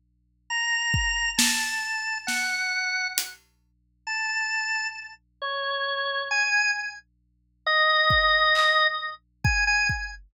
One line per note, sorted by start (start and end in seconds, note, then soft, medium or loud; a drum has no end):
0.50 1.31 A#5 medium
0.94 kick medium
1.37 2.18 A5 medium
1.37 snare medium
2.27 3.07 F#5 medium
2.27 snare medium
3.18 closed hi-hat medium
4.07 4.87 A5 medium
5.42 6.22 C#5 medium
6.31 6.71 G#5 medium
7.66 8.87 D#5 loud
8.10 kick medium
8.55 clap medium
9.44 9.64 G#5 medium
9.44 kick medium
9.67 9.87 G#5 loud
9.89 kick medium